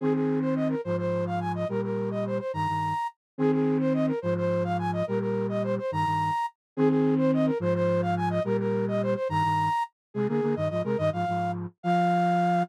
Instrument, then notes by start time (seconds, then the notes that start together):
flute
0.01 D#3 C4 G#4
0.14 G#4
0.41 C5
0.56 D#5
0.69 A#4
0.84 G#2 F3 C5
0.98 C5
1.27 F5
1.40 G#5
1.55 D#5
1.69 A#2 G3 A#4
1.83 A#4
2.11 D#5
2.27 C5
2.39 C5
2.53 G2 D#3 A#5
2.68 G2 D#3
3.38 D#3 C4 G#4
3.52 G#4
3.80 C5
3.94 D#5
4.07 A#4
4.22 G#2 F3 C5
4.37 C5
4.64 F5
4.79 G#5
4.93 D#5
5.07 A#2 G3 A#4
5.20 A#4
5.49 D#5
5.64 C5
5.78 C5
5.91 G2 D#3 A#5
6.05 G2 D#3
6.77 D#3 C4 G#4
6.89 G#4
7.18 C5
7.34 D#5
7.46 A#4
7.60 G#2 F3 C5
7.75 C5
8.02 F5
8.17 G#5
8.30 D#5
8.44 A#2 G3 A#4
8.59 A#4
8.88 D#5
9.02 C5
9.15 C5
9.29 G2 D#3 A#5
9.44 G2 D#3
10.14 C3 G#3 G#4
10.28 D3 A#3 G#4
10.42 D3 A#3
10.56 G2 D#3 D#5
10.70 G#2 F3 D#5
10.84 C3 G#3 A#4
10.98 G2 D#3 D#5
11.13 G#2 F3 F5
11.28 G#2 F3
11.83 F3 F5